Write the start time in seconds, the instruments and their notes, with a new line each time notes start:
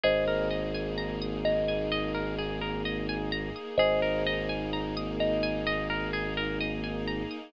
0.04 synth bass 2 G#1, string ensemble 1 A#3 D#4 G#4, orchestral harp G#4, kalimba C5 D#5
0.28 orchestral harp A#4
0.51 orchestral harp D#5
0.74 orchestral harp G#5
0.98 orchestral harp A#5
1.21 orchestral harp D#6
1.45 kalimba D#5, orchestral harp A#5
1.68 orchestral harp G#5
1.92 orchestral harp D#5
2.14 orchestral harp A#4
2.38 orchestral harp G#4
2.61 orchestral harp A#4
2.85 orchestral harp D#5
3.09 orchestral harp G#5
3.32 orchestral harp A#5
3.56 orchestral harp D#6
3.78 synth bass 2 G#1, string ensemble 1 A#3 D#4 G#4, orchestral harp G#4, kalimba C5 D#5
4.02 orchestral harp A#4
4.27 orchestral harp D#5
4.49 orchestral harp G#5
4.73 orchestral harp A#5
4.97 orchestral harp D#6
5.20 kalimba D#5, orchestral harp A#5
5.43 orchestral harp G#5
5.67 orchestral harp D#5
5.90 orchestral harp A#4
6.13 orchestral harp G#4
6.37 orchestral harp A#4
6.61 orchestral harp D#5
6.84 orchestral harp G#5
7.07 orchestral harp A#5
7.31 orchestral harp D#6